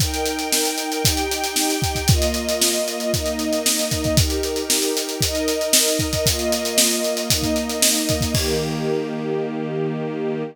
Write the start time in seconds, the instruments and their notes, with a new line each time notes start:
0.00 string ensemble 1 D#4 A#4 G5, kick, closed hi-hat
0.14 closed hi-hat
0.26 closed hi-hat
0.39 closed hi-hat
0.52 snare
0.65 closed hi-hat
0.78 closed hi-hat
0.92 closed hi-hat
1.04 string ensemble 1 D#4 G4 G5, kick, closed hi-hat
1.17 closed hi-hat
1.31 closed hi-hat
1.44 closed hi-hat
1.56 snare
1.70 closed hi-hat
1.82 kick, closed hi-hat
1.95 kick, closed hi-hat
2.08 string ensemble 1 A#3 F4 D#5, kick, closed hi-hat
2.22 closed hi-hat
2.34 closed hi-hat
2.49 closed hi-hat
2.62 snare
2.74 closed hi-hat
2.88 closed hi-hat
3.00 closed hi-hat
3.12 string ensemble 1 A#3 D#4 D#5, kick, closed hi-hat
3.26 closed hi-hat
3.39 closed hi-hat
3.53 closed hi-hat
3.66 snare
3.79 closed hi-hat
3.91 kick, closed hi-hat
4.04 kick, closed hi-hat
4.17 string ensemble 1 D#4 G4 A#4, kick, closed hi-hat
4.30 closed hi-hat
4.43 closed hi-hat
4.56 closed hi-hat
4.70 snare
4.82 closed hi-hat
4.97 closed hi-hat
5.09 closed hi-hat
5.21 string ensemble 1 D#4 A#4 D#5, kick, closed hi-hat
5.35 closed hi-hat
5.48 closed hi-hat
5.61 closed hi-hat
5.73 snare
5.88 closed hi-hat
5.99 kick, closed hi-hat
6.13 kick, closed hi-hat
6.25 string ensemble 1 A#3 F4 D#5, kick, closed hi-hat
6.39 closed hi-hat
6.52 closed hi-hat
6.65 closed hi-hat
6.78 snare
6.91 closed hi-hat
7.04 closed hi-hat
7.17 closed hi-hat
7.30 string ensemble 1 A#3 D#4 D#5, kick, closed hi-hat
7.42 kick, closed hi-hat
7.56 closed hi-hat
7.69 closed hi-hat
7.82 snare
7.96 closed hi-hat
8.09 kick, closed hi-hat
8.21 kick, closed hi-hat
8.34 string ensemble 1 D#3 A#3 G4, kick, crash